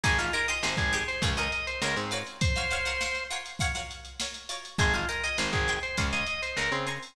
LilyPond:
<<
  \new Staff \with { instrumentName = "Drawbar Organ" } { \time 4/4 \key aes \mixolydian \tempo 4 = 101 aes'16 f'16 bes'16 ees''16 c''16 aes'8 c''16 r16 ees''16 ees''16 c''16 bes'16 c'16 r8 | c''4. r2 r8 | aes'16 f'16 bes'16 ees''16 c''16 aes'8 c''16 r16 ees''16 ees''16 c''16 bes'16 c'16 r8 | }
  \new Staff \with { instrumentName = "Pizzicato Strings" } { \time 4/4 \key aes \mixolydian <ees' g' aes' c''>16 <ees' g' aes' c''>16 <ees' g' aes' c''>16 <ees' g' aes' c''>16 <ees' g' aes' c''>8 <ees' g' aes' c''>8 <f' aes' bes' des''>16 <f' aes' bes' des''>8. <f' aes' bes' des''>8 <f' ges' bes' des''>8~ | <f' ges' bes' des''>16 <f' ges' bes' des''>16 <f' ges' bes' des''>16 <f' ges' bes' des''>16 <f' ges' bes' des''>8 <f' ges' bes' des''>8 <f' ges' bes' des''>16 <f' ges' bes' des''>8. <f' ges' bes' des''>8 <f' ges' bes' des''>8 | <ees'' g'' aes'' c'''>16 <ees'' g'' aes'' c'''>16 <ees'' g'' aes'' c'''>16 <ees'' g'' aes'' c'''>16 <ees'' g'' aes'' c'''>8 <ees'' g'' aes'' c'''>8 <f'' aes'' bes'' des'''>16 <f'' aes'' bes'' des'''>8. <f'' aes'' bes'' des'''>8 <f'' aes'' bes'' des'''>8 | }
  \new Staff \with { instrumentName = "Electric Bass (finger)" } { \clef bass \time 4/4 \key aes \mixolydian aes,,4 aes,,16 aes,,8. des,4 des,16 aes,8. | r1 | aes,,4 aes,,16 aes,,8. des,4 des,16 des8. | }
  \new DrumStaff \with { instrumentName = "Drums" } \drummode { \time 4/4 <hh bd>16 hh16 hh16 hh16 sn16 <hh bd>16 hh16 hh16 <hh bd>16 hh16 hh16 hh16 sn16 hh16 hh16 hh16 | <hh bd>16 <hh sn>16 hh16 hh16 sn16 hh16 hh16 hh16 <hh bd>16 hh16 hh16 hh16 sn16 hh16 hh16 hh16 | <hh bd>16 hh16 hh16 hh16 sn16 <hh bd>16 hh16 hh16 <hh bd>16 <hh sn>16 hh16 hh16 sn16 hh16 hh16 hho16 | }
>>